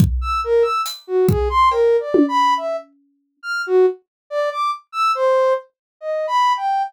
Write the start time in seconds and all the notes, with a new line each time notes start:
0.00 kick
0.21 E6
0.44 A#4
0.62 E6
0.86 closed hi-hat
1.07 F#4
1.29 G#4, kick
1.49 C6
1.71 A#4, cowbell
2.00 D5
2.14 high tom
2.28 B5
2.57 E5
3.43 F6
3.67 F#4
4.30 D5
4.51 D6
4.92 E6
5.15 C5
6.01 D#5
6.27 B5
6.57 G5